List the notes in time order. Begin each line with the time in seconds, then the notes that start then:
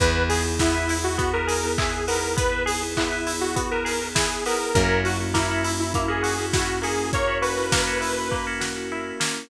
0.00 E2 B3 E4 G#4 B4, kick, closed hi-hat
0.16 B3 E4 G#4
0.29 G#4, open hi-hat
0.44 B3 E4 G#4
0.59 B3 E4 G#4, kick, snare
0.74 B3 E4 G#4
0.89 E4, open hi-hat
1.04 F#4
1.18 B3 F#4, kick, closed hi-hat
1.33 B3 E4 G#4 A#4
1.47 G#4, open hi-hat
1.63 B3 E4 G#4
1.78 E4 G#4, kick, clap
2.07 B3 E4 G#4 A#4, open hi-hat
2.37 B3 B4, kick, closed hi-hat
2.51 B3 E4 G#4
2.66 G#4, open hi-hat
2.82 B3 E4 G#4
2.97 B3 E4 G#4, kick, clap
3.12 B3 E4 G#4
3.27 E4, open hi-hat
3.41 F#4
3.56 B3 F#4, kick, closed hi-hat
3.71 B3 E4 G#4 A#4
3.85 G#4, open hi-hat
4.01 B3 E4 G#4
4.15 E4 G#4, kick, snare
4.46 B3 E4 G#4 A#4, open hi-hat
4.74 F#2 A#3 C#4 E4 F#4 A#4, kick, closed hi-hat
4.89 A#3 C#4 E4 F#4
5.05 F#4, open hi-hat
5.20 A#3 C#4 E4 F#4
5.34 A#3 C#4 E4 F#4, kick, snare
5.51 A#3 C#4 E4 F#4
5.64 E4, open hi-hat
5.79 E4
5.94 A#3 E4, kick, closed hi-hat
6.08 A#3 C#4 E4 F#4 G#4
6.23 F#4, open hi-hat
6.38 A#3 C#4 E4 F#4
6.53 E4 F#4, kick, snare
6.82 A#3 C#4 E4 F#4 G#4, open hi-hat
7.13 A#3 C#4 F#4 A#4 C#5, kick, closed hi-hat
7.27 A#3 C#4 E4 F#4
7.42 F#4 B4, open hi-hat
7.57 A#3 C#4 E4 F#4
7.72 A#3 C#4 E4 F#4, kick, snare
7.87 A#3 C#4 E4 F#4
8.01 E4, open hi-hat
8.31 A#3, kick
8.47 A#3 C#4 E4 F#4
8.60 F#4, snare
8.76 A#3 C#4 E4 F#4
8.92 E4
9.20 A#3 C#4 E4 F#4, snare